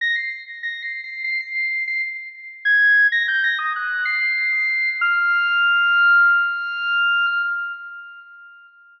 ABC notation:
X:1
M:4/4
L:1/16
Q:1/4=96
K:none
V:1 name="Lead 2 (sawtooth)"
_b' c'' z2 (3b'2 c''2 c''2 c'' c''3 c'' z3 | z _a'3 _b' g' b' _e' _g'2 c''6 | f'16 |]